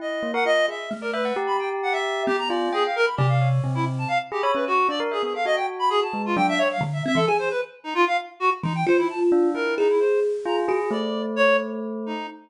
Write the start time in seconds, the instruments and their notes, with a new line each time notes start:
0.00 tubular bells E4, clarinet D#5
0.23 tubular bells A#3
0.34 tubular bells A#4, clarinet F#5
0.45 tubular bells F4, clarinet D#5
0.68 tubular bells G#4, clarinet E5
0.91 kalimba A3
1.01 clarinet A#4, tubular bells D5
1.13 clarinet B4, tubular bells E5
1.25 tubular bells F#5
1.36 tubular bells G4
1.47 clarinet B5
1.59 clarinet G5
1.83 clarinet F#5
1.92 clarinet E5
2.26 kalimba B3, clarinet G4
2.38 clarinet A#5
2.48 tubular bells F4, clarinet D5
2.73 clarinet G#4, tubular bells G5
2.85 clarinet F5
2.96 clarinet A#4
3.05 clarinet B5
3.17 kalimba C3, clarinet G4, tubular bells D5
3.28 clarinet F5
3.41 tubular bells C#5
3.64 kalimba C3, tubular bells C4
3.75 clarinet E4
3.98 clarinet A5
4.08 clarinet F5
4.32 clarinet G4, tubular bells G#4
4.41 tubular bells C#5, clarinet B5
4.55 tubular bells C#4, clarinet B4
4.67 clarinet F#4
4.89 tubular bells D4, clarinet D5
5.00 tubular bells A#4
5.11 clarinet G#4, tubular bells E5
5.23 tubular bells B3, clarinet G#4
5.34 tubular bells A4, clarinet F5
5.45 tubular bells F#4, clarinet D#5
5.56 clarinet G5
5.79 clarinet B5
5.90 clarinet G#4
6.02 clarinet A5
6.13 tubular bells G#3
6.25 clarinet F4
6.36 kalimba F#3, tubular bells D4, clarinet G5
6.49 clarinet E5
6.58 clarinet C#5
6.71 clarinet F5
6.81 kalimba D3
6.93 clarinet E5
7.06 kalimba C4, clarinet E5
7.15 kalimba E3, clarinet A4
7.27 kalimba G#4, clarinet G#5
7.39 clarinet C5
7.51 clarinet B4
7.84 clarinet D#4
7.95 clarinet F4
8.07 clarinet F5
8.40 clarinet F#4
8.63 kalimba E3, clarinet D#4
8.75 clarinet G5
8.87 kalimba F4, clarinet C5
8.98 clarinet E4
9.10 clarinet A5
9.32 tubular bells D4
9.54 tubular bells E4, clarinet A#4
9.78 clarinet D#4, kalimba G#4
9.89 clarinet E4
9.99 clarinet C5
10.46 tubular bells F4, clarinet A#5
10.68 kalimba F#4, tubular bells G#4
10.91 tubular bells A3, clarinet D5
11.36 clarinet C#5
12.06 clarinet D#4